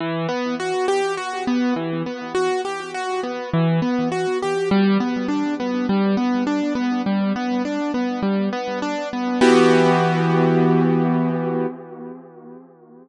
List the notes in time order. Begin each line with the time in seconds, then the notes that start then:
0.00 E3
0.29 B3
0.60 F#4
0.88 G4
1.17 F#4
1.47 B3
1.76 E3
2.06 B3
2.35 F#4
2.65 G4
2.94 F#4
3.23 B3
3.53 E3
3.82 B3
4.12 F#4
4.42 G4
4.71 G3
5.00 B3
5.28 D4
5.60 B3
5.89 G3
6.17 B3
6.47 D4
6.75 B3
7.06 G3
7.36 B3
7.65 D4
7.94 B3
8.23 G3
8.53 B3
8.82 D4
9.13 B3
9.41 E3 B3 F#4 G4